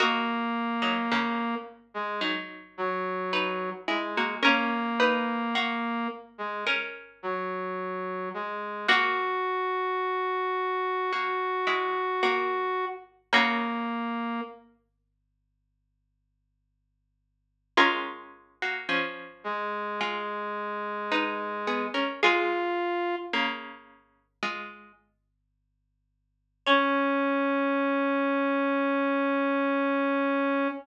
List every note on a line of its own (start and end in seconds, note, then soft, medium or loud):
0.00 0.72 A#3 medium
0.00 1.55 A#3 loud
0.00 0.72 F#4 loud
0.00 3.26 F#4 medium
0.00 3.26 D#5 loud
0.82 1.08 F#3 medium
0.82 1.08 D#4 medium
1.12 1.80 C#3 medium
1.12 1.80 A#3 medium
1.94 2.21 G#3 medium
2.21 3.60 F#3 medium
2.21 3.60 D#4 medium
2.78 3.70 F#3 medium
3.33 4.37 D#4 medium
3.33 4.37 B4 medium
3.88 4.14 G#3 medium
3.88 4.35 G#3 medium
3.88 4.14 E4 medium
4.17 4.44 A#3 medium
4.17 4.44 F#4 medium
4.43 6.08 A#3 loud
4.43 5.97 C#4 medium
4.43 4.94 C#4 loud
4.43 5.97 A#4 loud
4.43 4.94 A#4 loud
5.00 5.49 D#4 loud
5.00 5.49 B4 loud
5.55 6.59 A#3 medium
5.55 6.59 F#4 medium
6.38 6.65 G#3 medium
6.67 7.69 C#4 medium
6.67 7.69 A#4 loud
7.23 8.29 F#3 medium
8.34 8.87 G#3 medium
8.88 10.70 A#3 medium
8.88 11.95 A#3 loud
8.88 10.70 F#4 loud
8.88 12.85 F#4 loud
8.88 11.95 F#4 loud
11.12 11.63 A#3 medium
11.12 11.63 F#4 medium
11.67 13.26 G#3 medium
11.67 13.26 E4 medium
12.23 13.14 A#3 medium
12.23 13.14 F#4 loud
13.33 17.12 C#3 loud
13.33 17.12 A#3 loud
13.33 14.41 A#3 medium
13.33 14.94 A#3 loud
13.33 14.94 F#4 loud
17.77 20.50 G#3 loud
17.77 18.56 C#4 loud
17.77 20.50 F4 loud
17.77 18.56 A#4 loud
18.62 18.89 A#3 medium
18.62 18.89 F#4 medium
18.89 19.67 F3 medium
18.89 19.67 C#4 medium
19.44 21.86 G#3 medium
20.01 21.45 G#3 medium
20.01 21.45 F4 medium
21.12 22.17 D#4 medium
21.12 22.17 B4 loud
21.67 21.94 B3 medium
21.67 21.94 G#4 medium
21.94 22.21 C#4 medium
21.94 22.21 A#4 medium
22.22 23.31 G#3 loud
22.22 23.16 F4 loud
22.22 23.31 F4 loud
22.22 23.20 G#4 loud
22.22 23.20 F5 loud
23.33 24.27 C#3 medium
23.33 24.27 A#3 medium
24.43 24.92 G#3 medium
24.43 24.92 F4 medium
26.66 30.68 C#4 loud
26.66 30.69 C#4 loud
26.66 30.68 C#5 loud